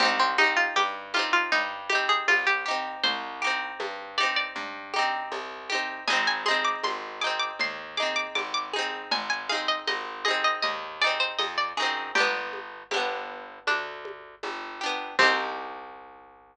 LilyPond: <<
  \new Staff \with { instrumentName = "Pizzicato Strings" } { \time 4/4 \key c \minor \tempo 4 = 79 c'16 c'16 ees'16 f'16 g'8 f'16 f'16 ees'8 g'16 aes'16 f'16 g'16 r8 | c''4. d''16 d''4.~ d''16 r8 | aes''16 aes''16 c'''16 d'''16 c'''8 d'''16 d'''16 c'''8 d'''16 d'''16 d'''16 d'''16 r8 | aes''16 aes''16 f''16 ees''16 ees''8 ees''16 ees''16 ees''8 d''16 c''16 ees''16 d''16 r8 |
g'4. r8 d'2 | c'1 | }
  \new Staff \with { instrumentName = "Pizzicato Strings" } { \time 4/4 \key c \minor <c' ees' g'>8 <c' ees' g'>4 <c' ees' g'>4 <c' ees' g'>4 <c' ees' g'>8~ | <c' ees' g'>8 <c' ees' g'>4 <c' ees' g'>4 <c' ees' g'>4 <c' ees' g'>8 | <c' ees' aes'>8 <c' ees' aes'>4 <c' ees' aes'>4 <c' ees' aes'>4 <c' ees' aes'>8~ | <c' ees' aes'>8 <c' ees' aes'>4 <c' ees' aes'>4 <c' ees' aes'>4 <c' ees' aes'>8 |
<b d' g'>4 <b d' g'>2~ <b d' g'>8 <b d' g'>8 | <c' ees' g'>1 | }
  \new Staff \with { instrumentName = "Electric Bass (finger)" } { \clef bass \time 4/4 \key c \minor c,4 g,4 g,4 c,4 | c,4 g,4 g,4 c,4 | aes,,4 aes,,4 ees,4 aes,,4 | aes,,4 aes,,4 ees,4 f,8 ges,8 |
g,,4 g,,4 d,4 g,,4 | c,1 | }
  \new DrumStaff \with { instrumentName = "Drums" } \drummode { \time 4/4 <cgl cb>8 cgho8 <cgho cb tamb>8 cgho8 <cgl cb>8 cgho8 <cgho cb tamb>4 | <cgl cb>4 <cgho cb tamb>8 cgho8 <cgl cb>8 cgho8 <cgho cb tamb>8 cgho8 | <cgl cb>8 cgho8 <cgho cb tamb>4 <cgl cb>4 <cgho cb tamb>8 cgho8 | <cgl cb>8 cgho8 <cgho cb tamb>8 cgho8 <cgl cb>4 <cgho cb tamb>8 cgho8 |
<cgl cb>8 cgho8 <cgho cb tamb>4 <cgho cb>8 cgho8 <cgho cb tamb>4 | <cymc bd>4 r4 r4 r4 | }
>>